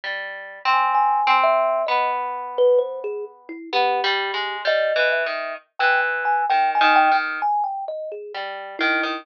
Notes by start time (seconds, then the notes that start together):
0.04 G3
0.65 C4
0.73 G#5
0.95 G#5
1.27 C4
1.43 E5
1.87 B3 D#5
2.58 B4
2.78 C5
3.04 G#4
3.49 E4
3.73 B3 G4
4.04 G3
4.34 G#3
4.65 G3 D#5
4.96 E3
5.12 E5
5.26 D#3
5.79 E3 G5
6.25 G#5
6.49 D#3 G5
6.75 G#5
6.81 D#3
6.96 G5
7.12 D#3
7.42 G#5
7.64 G5
7.88 D#5
8.12 G#4
8.34 G3
8.79 D#3 E4
9.03 D#3